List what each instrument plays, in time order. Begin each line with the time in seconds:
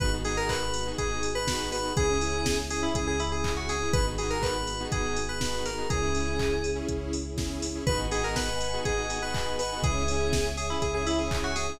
0.00 synth bass 2 G#1, lead 2 (sawtooth) B3 D#4 F#4 G#4, string ensemble 1 B3 D#4 F#4 G#4, electric piano 2 B4, kick, closed hi-hat
0.13 lead 2 (sawtooth) B3 D#4 F#4 G#4
0.25 lead 2 (sawtooth) B3 D#4 F#4 G#4, electric piano 2 G#4, open hi-hat
0.37 electric piano 2 A#4
0.49 electric piano 2 B4, kick, clap
0.74 open hi-hat
0.86 lead 2 (sawtooth) B3 D#4 F#4 G#4
0.98 synth bass 2 G#1, electric piano 2 G#4, kick, closed hi-hat
1.23 open hi-hat
1.35 electric piano 2 B4
1.48 lead 2 (sawtooth) B3 D#4 F#4 G#4, kick, snare
1.72 electric piano 2 B4, snare, open hi-hat
1.83 lead 2 (sawtooth) B3 D#4 F#4 G#4
1.96 synth bass 2 C#2, lead 2 (sawtooth) C#4 E4 G#4, string ensemble 1 C#4 E4 G#4, electric piano 2 G#4, kick, closed hi-hat
2.09 lead 2 (sawtooth) C#4 E4 G#4
2.21 lead 2 (sawtooth) C#4 E4 G#4, open hi-hat
2.46 kick, snare
2.70 electric piano 2 G#4, open hi-hat
2.81 lead 2 (sawtooth) C#4 E4 G#4, electric piano 2 E4
2.94 synth bass 2 C#2, electric piano 2 G#4, kick, closed hi-hat
3.07 electric piano 2 G#4
3.20 electric piano 2 E4, open hi-hat
3.32 electric piano 2 G#4
3.44 lead 2 (sawtooth) C#4 E4 G#4, kick, clap
3.57 electric piano 2 F#4
3.69 electric piano 2 G#4, snare, open hi-hat
3.82 lead 2 (sawtooth) C#4 E4 G#4
3.93 synth bass 2 G#1, string ensemble 1 B3 D#4 F#4 G#4, lead 2 (sawtooth) B3 D#4 F#4 G#4, electric piano 2 B4, kick, closed hi-hat
4.07 lead 2 (sawtooth) B3 D#4 F#4 G#4
4.17 lead 2 (sawtooth) B3 D#4 F#4 G#4, electric piano 2 G#4, open hi-hat
4.30 electric piano 2 A#4
4.43 electric piano 2 B4, kick, clap
4.67 open hi-hat
4.80 lead 2 (sawtooth) B3 D#4 F#4 G#4
4.91 synth bass 2 G#1, electric piano 2 G#4, kick, closed hi-hat
5.16 open hi-hat
5.29 electric piano 2 B4
5.41 lead 2 (sawtooth) B3 D#4 F#4 G#4, kick, snare
5.65 electric piano 2 A#4, snare, open hi-hat
5.77 lead 2 (sawtooth) B3 D#4 F#4 G#4
5.89 synth bass 2 C#2, lead 2 (sawtooth) C#4 E4 G#4, string ensemble 1 C#4 E4 G#4, electric piano 2 G#4, kick, closed hi-hat
6.02 lead 2 (sawtooth) C#4 E4 G#4
6.15 lead 2 (sawtooth) C#4 E4 G#4, open hi-hat
6.39 kick, clap
6.64 open hi-hat
6.75 lead 2 (sawtooth) C#4 E4 G#4
6.88 synth bass 2 C#2, kick, closed hi-hat
7.13 open hi-hat
7.37 lead 2 (sawtooth) C#4 E4 G#4, kick, snare
7.62 snare, open hi-hat
7.75 lead 2 (sawtooth) C#4 E4 G#4
7.87 synth bass 2 G#1, lead 2 (sawtooth) B3 D#4 F#4 G#4, electric piano 2 B4, string ensemble 1 B4 D#5 F#5 G#5, kick, closed hi-hat
8.10 lead 2 (sawtooth) B3 D#4 F#4 G#4, electric piano 2 G#4, open hi-hat
8.24 electric piano 2 A#4
8.36 electric piano 2 B4, kick, snare
8.61 open hi-hat
8.73 lead 2 (sawtooth) B3 D#4 F#4 G#4
8.85 synth bass 2 G#1, electric piano 2 G#4, kick, closed hi-hat
8.97 lead 2 (sawtooth) B3 D#4 F#4 G#4
9.09 lead 2 (sawtooth) B3 D#4 F#4 G#4, open hi-hat
9.21 lead 2 (sawtooth) B3 D#4 F#4 G#4, electric piano 2 B4
9.34 kick, clap
9.59 electric piano 2 B4, snare, open hi-hat
9.72 lead 2 (sawtooth) B3 D#4 F#4 G#4
9.82 synth bass 2 C#2, lead 2 (sawtooth) C#4 E4 G#4, electric piano 2 G#4, string ensemble 1 C#5 E5 G#5, kick, closed hi-hat
10.08 lead 2 (sawtooth) C#4 E4 G#4, open hi-hat
10.33 kick, snare
10.57 electric piano 2 G#4, open hi-hat
10.70 lead 2 (sawtooth) C#4 E4 G#4, electric piano 2 E4
10.82 synth bass 2 C#2, electric piano 2 G#4, kick, closed hi-hat
10.94 lead 2 (sawtooth) C#4 E4 G#4, electric piano 2 G#4
11.06 lead 2 (sawtooth) C#4 E4 G#4, electric piano 2 E4, open hi-hat
11.19 lead 2 (sawtooth) C#4 E4 G#4, electric piano 2 G#4
11.31 kick, clap
11.44 electric piano 2 F#4
11.56 electric piano 2 G#4, snare, open hi-hat
11.68 lead 2 (sawtooth) C#4 E4 G#4